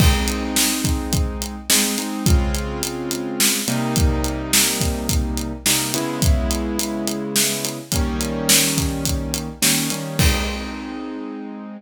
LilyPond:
<<
  \new Staff \with { instrumentName = "Acoustic Grand Piano" } { \time 4/4 \key aes \major \tempo 4 = 106 <aes c' ees'>2. <aes c' ees'>8 <aes c' ees'>8 | \time 3/4 <des aes c' f'>2~ <des aes c' f'>8 <c g bes ees'>8~ | \time 4/4 <c g bes ees'>2. <c g bes ees'>8 <des aes ces' fes'>8~ | \time 3/4 <des aes ces' fes'>2. |
\time 4/4 <ees g bes des'>2. <ees g bes des'>8 <ees g bes des'>8 | \time 3/4 <aes c' ees'>2. | }
  \new DrumStaff \with { instrumentName = "Drums" } \drummode { \time 4/4 <cymc bd>8 hh8 sn8 <hh bd>8 <hh bd>8 hh8 sn8 hh8 | \time 3/4 <hh bd>8 hh8 hh8 hh8 sn8 hh8 | \time 4/4 <hh bd>8 hh8 sn8 <hh bd>8 <hh bd>8 hh8 sn8 hh8 | \time 3/4 <hh bd>8 hh8 hh8 hh8 sn8 hh8 |
\time 4/4 <hh bd>8 hh8 sn8 <hh bd>8 <hh bd>8 hh8 sn8 hh8 | \time 3/4 <cymc bd>4 r4 r4 | }
>>